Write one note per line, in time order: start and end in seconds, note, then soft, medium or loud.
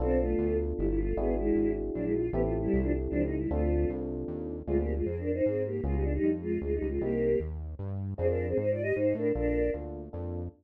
0.00 0.35 B1 medium
0.00 1.05 B3 loud
0.00 0.19 C4 loud
0.00 1.05 D4 loud
0.00 1.05 F4 loud
0.00 1.05 A4 loud
0.00 0.19 A4 loud
0.20 0.57 A3 medium
0.20 0.57 F4 medium
0.38 0.73 D2 medium
0.77 1.14 G1 medium
0.77 0.87 G3 medium
0.77 0.87 E4 medium
0.89 0.99 G3 medium
0.89 0.99 E4 medium
0.98 1.16 A3 medium
0.98 1.16 F4 medium
1.17 1.52 G#1 medium
1.17 1.35 B3 medium
1.17 2.22 D4 loud
1.17 2.22 E4 loud
1.17 2.22 F#4 loud
1.17 2.22 G#4 loud
1.17 1.35 G#4 loud
1.38 1.72 G#3 medium
1.38 1.72 E4 medium
1.56 1.91 G#1 medium
1.95 2.30 A#1 medium
1.95 2.04 F#3 medium
1.95 2.04 D4 medium
2.04 2.13 G#3 medium
2.04 2.13 E4 medium
2.14 2.30 F4 medium
2.32 2.68 A1 medium
2.32 2.41 B3 loud
2.32 3.39 C4 loud
2.32 3.39 E4 loud
2.32 2.41 G4 loud
2.32 3.39 G4 loud
2.32 3.39 A4 loud
2.44 2.54 A3 medium
2.44 2.54 F4 medium
2.62 2.80 G3 loud
2.62 2.80 E4 loud
2.73 3.08 C2 medium
2.83 2.92 F3 medium
2.83 2.92 D4 medium
3.10 3.47 C#2 medium
3.10 3.22 F3 medium
3.10 3.22 D4 loud
3.24 3.37 D#4 medium
3.37 3.49 G3 medium
3.37 3.49 E4 medium
3.51 3.86 D2 medium
3.51 3.90 A3 medium
3.51 4.56 C4 loud
3.51 4.56 D4 loud
3.51 4.56 F4 loud
3.51 3.90 F4 medium
3.51 4.56 A4 loud
3.90 4.25 C2 medium
4.28 4.63 D#2 medium
4.67 5.02 D2 medium
4.67 4.77 G#3 loud
4.67 4.95 C4 medium
4.67 4.95 D4 loud
4.67 4.77 F4 loud
4.67 4.95 F4 medium
4.67 4.95 G#4 medium
4.77 4.94 A#3 medium
4.77 4.94 G4 medium
4.96 5.05 G#3 medium
4.96 5.05 F4 medium
5.05 5.41 F2 medium
5.05 5.17 C4 medium
5.05 5.17 G#4 medium
5.19 5.31 D4 medium
5.19 5.31 A#4 medium
5.33 5.45 D#4 medium
5.33 5.45 C5 medium
5.45 5.81 G#2 medium
5.45 5.63 C4 medium
5.45 5.63 G#4 medium
5.66 5.81 A#3 medium
5.66 5.81 G4 medium
5.84 6.19 C#2 medium
5.84 5.95 G#3 loud
5.84 6.12 B3 medium
5.84 6.12 C#4 medium
5.84 6.12 F4 medium
5.84 5.95 F4 loud
5.84 6.12 G#4 medium
5.94 6.04 G3 medium
5.94 6.04 D#4 medium
6.03 6.13 D4 medium
6.13 6.30 G3 medium
6.13 6.30 D#4 loud
6.23 6.58 F2 medium
6.42 6.59 G#3 loud
6.42 6.59 F4 loud
6.62 6.79 D2 medium
6.62 6.74 G#3 medium
6.62 6.74 F4 medium
6.74 6.87 G3 medium
6.74 6.87 D#4 medium
6.82 6.99 C#2 medium
6.89 7.01 G#3 medium
6.89 7.01 F4 medium
7.01 7.36 C2 medium
7.01 7.29 A#3 medium
7.01 7.39 A#3 loud
7.01 7.29 C4 medium
7.01 7.29 D#4 medium
7.01 7.29 G4 medium
7.01 7.39 G4 loud
7.40 7.75 D#2 medium
7.79 8.14 G2 medium
8.18 8.54 F2 medium
8.18 8.27 C4 loud
8.18 8.45 C4 medium
8.18 8.45 D4 medium
8.18 8.45 F4 medium
8.18 8.27 G#4 loud
8.18 8.45 G#4 medium
8.28 8.46 D4 medium
8.28 8.46 A#4 medium
8.48 8.57 C4 medium
8.48 8.57 G#4 medium
8.57 8.92 G#2 medium
8.57 8.70 D#4 medium
8.57 8.70 C5 medium
8.70 8.83 F4 medium
8.70 8.83 D5 medium
8.82 8.94 G4 medium
8.82 8.94 D#5 loud
8.95 9.14 G#2 medium
8.95 9.13 D#4 medium
8.95 9.13 C5 medium
9.15 9.32 A2 medium
9.15 9.32 D4 medium
9.15 9.32 A#4 medium
9.35 9.70 A#1 medium
9.35 9.62 A#3 medium
9.35 9.62 D4 medium
9.35 9.70 D4 loud
9.35 9.62 F4 medium
9.35 9.62 A4 medium
9.35 9.70 A#4 loud
9.74 10.09 D2 medium
9.74 10.01 A#3 medium
9.74 10.01 D4 medium
9.74 10.01 F4 medium
9.74 10.01 A4 medium
10.13 10.49 F2 medium
10.13 10.40 A#3 medium
10.13 10.40 D4 medium
10.13 10.40 F4 medium
10.13 10.40 A4 medium